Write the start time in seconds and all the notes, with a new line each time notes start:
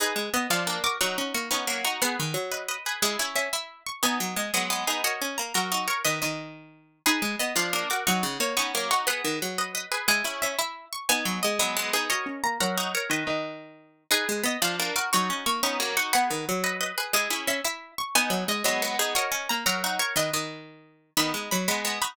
0.00 D#4 G#4 B4
0.16 G#3
0.34 B3 D#5
0.50 F3 D4 F4 F5
0.67 A#3 D4
0.84 F#4 A#4 D6
1.01 F#3 D#4 F#4 C#6
1.18 C#4
1.34 A#3 C#6
1.51 B3 C#4 D#4 C#6
1.67 F#3 A#3
1.85 D#4 F#4 C#6
2.02 B3 G#4 B4 F#5
2.20 D#3
2.34 F#3
2.52 B4 D#5
2.68 B4 D#5
2.86 G#4 B4
3.02 G#3 E4 G#4
3.19 C#4 E4
3.36 C#4 E5
3.53 E4 E5
3.86 C#6
4.03 B3 D#4 G#5
4.20 F#3
4.36 G#3 D#5
4.54 F#3 G#3 B3 D#5
4.70 G#3 B3
4.87 B3 D#4 G#4
5.04 F#4 A#4 C#5 D#5
5.22 C#4
5.38 A#3 A#5
5.54 F#3 F#4 A#4 A#5
5.72 D#4 F#4
5.88 A#4 C#5 C#6
6.05 D#3 B4 D#5
6.22 D#3 D#5
7.06 D#4 G#4 B4
7.22 G#3
7.39 B3 D#5
7.56 F3 D4 F4 F5
7.73 A#3 D4
7.90 F#4 A#4 D6
8.07 F#3 D#4 F#4 C#6
8.23 C#3
8.40 A#3 C#5
8.57 B3 C#4 D#4 C#6
8.75 F#3 A#3
8.91 D#4 F#4 C#6
9.07 B3 G#4 B4 F#5
9.25 D#3
9.42 F#3
9.58 B4 D#5
9.75 B4 D#5
9.92 G#4 B4
10.08 G#3 E4 G#4
10.24 C#4 E4
10.42 C#4 E5
10.59 E4 E5
10.93 C#6
11.09 B3 D#4 G#5
11.25 F#3
11.43 G#3 D#5
11.59 F#3 G#3 B3 D#5
11.77 G#3 B3
11.93 B3 D#4 G#4
12.10 F#4 A#4 C#5 D#5
12.26 C#4
12.44 A#3 A#5
12.60 F#3 F#4 A#4 A#5
12.78 D#4 F#4
12.94 A#4 C#5 C#6
13.10 D#3 B4 D#5
13.27 D#3 D#5
14.11 D#4 G#4 B4
14.29 G#3
14.43 B3 D#5
14.62 F3 D4 F4 F5
14.80 A#3 D4
14.96 F#4 A#4 D6
15.13 F#3 D#4 F#4 C#6
15.30 C#4
15.46 A#3 C#6
15.63 B3 C#4 D#4 C#6
15.80 F#3 A#3
15.97 D#4 F#4 C#6
16.13 B3 G#4 B4 F#5
16.30 D#3
16.49 F#3
16.64 B4 D#5
16.81 B4 D#5
16.98 G#4 B4
17.13 G#3 E4 G#4
17.30 C#4 E4
17.47 C#4 E5
17.64 E4 E5
17.98 C#6
18.15 B3 D#4 G#5
18.30 F#3
18.48 G#3 D#5
18.64 F#3 G#3 B3 D#5
18.82 G#3 B3
18.99 B3 D#4 G#4
19.15 F#4 A#4 C#5 D#5
19.32 C#4
19.49 A#3 A#5
19.66 F#3 F#4 A#4 A#5
19.84 D#4 F#4
19.99 A#4 C#5 C#6
20.16 D#3 B4 D#5
20.33 D#3 D#5
21.17 D#3 B3 D#4 B5
21.34 G#3
21.51 F#3 B5
21.68 G#3 B3 B5
21.85 G#3 B3
22.02 D#4 F#4 B5